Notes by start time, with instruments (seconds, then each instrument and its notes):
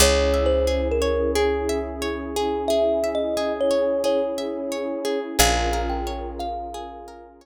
0.00 electric bass (finger) C#2, pad 2 (warm) C#4 E4 G#4, orchestral harp G#4, kalimba C#5
0.34 orchestral harp E5
0.46 kalimba C5
0.67 orchestral harp G#4
0.91 kalimba A#4
1.02 orchestral harp C#5
1.35 kalimba G#4, orchestral harp G#4
1.69 orchestral harp E5
2.02 orchestral harp C#5
2.36 orchestral harp G#4
2.68 orchestral harp G#4, kalimba E5
3.04 orchestral harp E5
3.15 kalimba D#5
3.37 orchestral harp G#4
3.61 kalimba C#5
3.71 orchestral harp C#5
4.04 orchestral harp G#4, kalimba C#5
4.38 orchestral harp E5
4.72 orchestral harp C#5
5.05 orchestral harp G#4
5.39 electric bass (finger) A#1, pad 2 (warm) C#4 F4 G#4 A#4, orchestral harp G#4, kalimba F5
5.73 orchestral harp A#4
5.89 kalimba G5
6.07 orchestral harp C#5
6.39 kalimba F5, orchestral harp F5
6.74 orchestral harp G#4
7.08 orchestral harp A#4
7.41 orchestral harp C#5